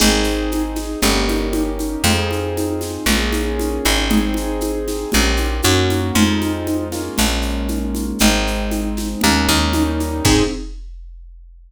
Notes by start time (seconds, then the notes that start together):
0.00 G#1 C4 D#4 G#4, crash, low conga, shaker
0.24 shaker
0.52 high conga, shaker
0.76 snare, high conga, shaker
1.02 G1 A#3 C#4 D#4 G4, low conga, shaker
1.28 high conga, shaker
1.53 high conga, shaker
1.79 high conga, shaker
2.04 F2 C4 D#4 F4 G#4, low conga, shaker
2.31 high conga, shaker
2.57 high conga, shaker
2.81 snare, high conga, shaker
3.06 A#1 A#3 C#4 F4 G#4, low conga, shaker
3.33 high conga, shaker
3.60 high conga, shaker
3.85 G#1, high conga, shaker
4.10 C4 D#4 G#4, low conga, shaker
4.34 high conga, shaker
4.61 high conga, shaker
4.88 snare, high conga, shaker
5.12 A#1 A#3 C#4 F4 G4, low conga, shaker
5.37 high conga, shaker
5.62 F#2 A#3 C#4 F#4, high conga, shaker
5.90 high conga, shaker
6.15 F2 G#3 C4 D#4 F4, low conga, shaker
6.42 high conga, shaker
6.67 high conga, shaker
6.92 G#3 A#3 C#4 F4, snare, high conga, shaker
7.18 A#1, low conga, shaker
7.42 shaker
7.68 high conga, shaker
7.95 high conga, shaker
8.19 G#1 G#3 C4 D#4, low conga, shaker
8.47 shaker
8.71 high conga, shaker
8.97 snare, high conga, shaker
9.21 D#2 G#3 A#3 C#4 D#4, low conga, shaker
9.48 D#2, high conga, shaker
9.73 G3 A#3 C#4 D#4, high conga, shaker
10.00 high conga, shaker
10.25 G#2 C4 D#4 G#4, kick, crash